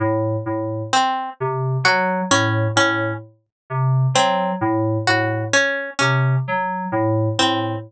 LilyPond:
<<
  \new Staff \with { instrumentName = "Electric Piano 2" } { \clef bass \time 6/8 \tempo 4. = 43 a,8 a,8 r8 c8 ges8 a,8 | a,8 r8 c8 ges8 a,8 a,8 | r8 c8 ges8 a,8 a,8 r8 | }
  \new Staff \with { instrumentName = "Harpsichord" } { \time 6/8 r4 c'8 r8 ges'8 des'8 | des'8 r4 c'8 r8 ges'8 | des'8 des'8 r4 c'8 r8 | }
>>